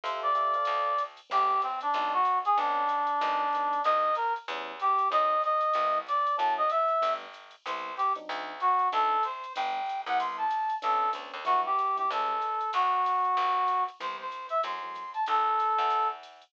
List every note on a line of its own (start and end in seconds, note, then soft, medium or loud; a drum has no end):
0.04 0.57 F2 medium
0.04 0.28 G4 loud
0.04 0.28 A4 loud
0.04 0.21 C5 medium
0.04 0.28 E5 loud
0.04 0.28 F5 loud
0.04 ride loud
0.22 1.02 D5 medium
0.35 0.53 G4 medium
0.35 0.53 A4 medium
0.35 0.53 E5 medium
0.35 0.53 F5 medium
0.35 hi-hat pedal medium
0.35 ride medium
0.54 0.92 A4 loud
0.54 0.92 C5 loud
0.54 0.92 D5 loud
0.54 0.92 F5 loud
0.54 ride medium
0.65 1.21 D2 medium
0.65 ride loud
0.98 hi-hat pedal medium
0.98 ride medium
1.17 ride medium
1.30 1.84 A1 loud
1.30 1.54 G3 loud
1.30 1.54 A3 loud
1.30 1.54 B3 loud
1.30 1.54 C4 loud
1.30 1.61 G4 medium
1.30 ride loud
1.62 1.80 C4 medium
1.62 hi-hat pedal medium
1.62 ride medium
1.81 2.13 D4 medium
1.81 ride medium
1.94 2.47 B1 medium
1.94 2.19 F#3 loud
1.94 2.19 G#3 loud
1.94 2.19 B3 loud
1.94 2.19 D#4 loud
1.94 kick medium
1.94 ride medium
2.13 2.39 F#4 medium
2.25 kick medium
2.25 hi-hat pedal medium
2.25 ride medium
2.45 2.57 G#4 medium
2.45 ride medium
2.57 3.11 B1 medium
2.57 2.81 A3 loud
2.57 2.81 B3 loud
2.57 2.81 C#4 loud
2.57 2.81 D4 loud
2.57 3.81 D4 medium
2.57 ride medium
2.88 hi-hat pedal medium
2.88 ride medium
3.07 ride medium
3.21 3.75 G#1 medium
3.21 3.45 F#3 loud
3.21 3.45 G#3 loud
3.21 3.45 B3 loud
3.21 3.45 D#4 loud
3.21 ride loud
3.53 3.77 F#3 medium
3.53 3.77 G#3 medium
3.53 3.77 B3 medium
3.53 3.77 D#4 medium
3.53 hi-hat pedal medium
3.53 ride medium
3.73 ride medium
3.84 4.39 C2 medium
3.84 4.09 G3 loud
3.84 4.09 A#3 loud
3.84 4.09 C4 loud
3.84 4.09 D#4 loud
3.84 4.15 D#5 medium
3.84 ride loud
4.15 4.33 A#4 medium
4.15 hi-hat pedal medium
4.15 ride medium
4.36 ride medium
4.48 5.01 E2 loud
4.48 4.72 G3 loud
4.48 4.72 B3 loud
4.48 4.72 C#4 loud
4.48 4.72 E4 loud
4.48 ride medium
4.80 5.08 G4 medium
4.80 kick medium
4.80 hi-hat pedal medium
4.80 ride medium
4.98 ride medium
5.10 5.65 F#2 medium
5.10 5.34 F#3 loud
5.10 5.34 A3 loud
5.10 5.34 C4 loud
5.10 5.34 D#4 loud
5.10 5.42 D#5 medium
5.10 ride medium
5.42 5.98 D#5 medium
5.42 hi-hat pedal medium
5.42 ride medium
5.61 ride medium
5.73 6.28 C2 medium
5.73 6.00 G3 loud
5.73 6.00 B3 loud
5.73 6.00 C4 loud
5.73 6.00 E4 loud
5.73 ride medium
6.07 6.35 D5 medium
6.07 hi-hat pedal medium
6.07 ride medium
6.27 ride medium
6.37 6.92 F#2 medium
6.37 6.62 F#3 loud
6.37 6.62 A3 loud
6.37 6.62 C#4 loud
6.37 6.62 E4 loud
6.37 6.54 A5 medium
6.37 ride medium
6.57 6.70 D#5 medium
6.69 7.13 E5 medium
6.69 hi-hat pedal medium
6.69 ride medium
6.88 ride medium
7.01 7.56 G1 medium
7.01 7.26 G3 loud
7.01 7.26 A3 loud
7.01 7.26 B3 loud
7.01 7.26 D4 loud
7.01 ride loud
7.33 hi-hat pedal medium
7.33 ride medium
7.51 ride medium
7.66 8.19 C2 medium
7.66 7.91 G3 loud
7.66 7.91 B3 loud
7.66 7.91 C4 loud
7.66 7.91 E4 loud
7.66 7.95 C5 medium
7.66 ride loud
7.97 8.13 G4 medium
7.97 kick medium
7.97 hi-hat pedal medium
7.97 ride medium
8.15 8.53 F#3 loud
8.15 8.53 C4 loud
8.15 8.53 D4 loud
8.15 8.53 D#4 loud
8.15 ride medium
8.29 8.82 D2 loud
8.29 ride medium
8.60 8.88 F#4 medium
8.60 hi-hat pedal medium
8.60 ride medium
8.79 ride medium
8.92 9.46 D2 loud
8.92 9.16 F#3 loud
8.92 9.16 C4 loud
8.92 9.16 D4 loud
8.92 9.16 D#4 loud
8.92 9.24 A4 medium
8.92 ride medium
9.23 9.53 C5 medium
9.23 hi-hat pedal medium
9.23 ride medium
9.44 ride medium
9.56 10.05 G1 medium
9.56 9.80 G3 loud
9.56 9.80 A3 loud
9.56 9.80 B3 loud
9.56 9.80 D4 loud
9.56 10.01 G5 medium
9.56 ride loud
9.86 hi-hat pedal medium
9.86 ride medium
10.06 10.72 C2 medium
10.06 10.44 G3 loud
10.06 10.44 B3 loud
10.06 10.44 C4 loud
10.06 10.44 E4 loud
10.06 10.18 F#5 medium
10.06 ride medium
10.20 10.37 C6 medium
10.20 ride loud
10.37 10.75 A5 medium
10.50 hi-hat pedal medium
10.50 ride medium
10.70 ride medium
10.82 11.14 B1 medium
10.82 11.06 A3 medium
10.82 11.06 B3 loud
10.82 11.06 C#4 loud
10.82 11.06 D4 loud
10.82 11.10 A4 medium
10.82 kick medium
10.82 ride loud
11.13 11.32 D2 medium
11.13 11.37 A3 medium
11.13 11.37 B3 medium
11.13 11.37 C#4 medium
11.13 11.37 D4 medium
11.13 hi-hat pedal medium
11.13 ride medium
11.34 11.45 D#2 medium
11.34 ride medium
11.45 12.00 E2 medium
11.45 11.69 F#3 loud
11.45 11.69 G3 loud
11.45 11.69 D4 medium
11.45 11.69 E4 loud
11.45 11.61 F#4 medium
11.45 ride medium
11.66 11.96 G4 medium
11.79 hi-hat pedal medium
11.79 ride medium
11.96 12.05 F#3 loud
11.96 12.05 G3 medium
11.96 12.05 D4 medium
11.96 12.05 E4 medium
11.96 12.10 G4 medium
11.96 ride medium
12.11 12.64 C#2 medium
12.11 12.35 F#3 loud
12.11 12.35 G3 loud
12.11 12.35 A3 medium
12.11 12.35 C#4 loud
12.11 12.70 A4 medium
12.11 ride loud
12.42 hi-hat pedal medium
12.42 ride medium
12.61 ride medium
12.73 13.27 D2 medium
12.73 13.84 F#4 medium
12.73 ride loud
13.05 kick medium
13.05 hi-hat pedal medium
13.05 ride medium
13.24 ride medium
13.37 13.90 G1 medium
13.37 kick medium
13.37 ride medium
13.67 hi-hat pedal medium
13.67 ride medium
13.88 ride medium
14.00 14.54 C2 medium
14.00 14.24 E3 loud
14.00 14.24 G3 loud
14.00 14.24 B3 medium
14.00 14.24 C4 medium
14.00 14.16 C5 medium
14.00 ride medium
14.21 14.47 C5 medium
14.31 hi-hat pedal medium
14.31 ride medium
14.49 14.61 E5 medium
14.49 ride medium
14.63 15.17 F#2 medium
14.63 14.77 E3 loud
14.63 14.77 F#3 loud
14.63 14.77 A3 loud
14.63 14.77 C4 loud
14.63 15.11 C6 medium
14.63 ride medium
14.82 15.03 E3 loud
14.82 15.03 F#3 loud
14.82 15.03 A3 medium
14.82 15.03 C4 medium
14.95 kick medium
14.95 hi-hat pedal medium
14.95 ride medium
15.14 15.25 A5 medium
15.14 ride medium
15.26 15.75 B1 medium
15.26 16.08 A4 medium
15.26 ride medium
15.59 kick medium
15.59 hi-hat pedal medium
15.59 ride medium
15.78 16.44 E2 medium
15.78 ride medium
15.90 ride medium
16.23 hi-hat pedal medium
16.23 ride medium
16.42 ride medium